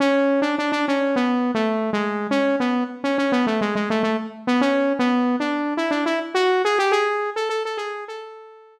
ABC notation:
X:1
M:4/4
L:1/16
Q:1/4=104
K:A
V:1 name="Lead 2 (sawtooth)"
C3 D D D C2 (3B,4 A,4 G,4 | C2 B,2 z C C B, A, G, G, A, A, z2 B, | (3C4 B,4 D4 E D E z F2 G =G | G3 A A A G2 A6 z2 |]